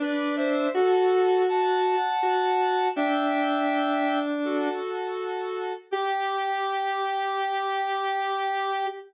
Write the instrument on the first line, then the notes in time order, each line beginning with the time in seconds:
lead 1 (square)
0.00 D4 B4 D5
0.36 C5 E5
0.74 F#4 A4
1.48 F#5 A5
2.23 F#4
2.96 D4 E5 G5
4.44 F#4 A4
5.91 G4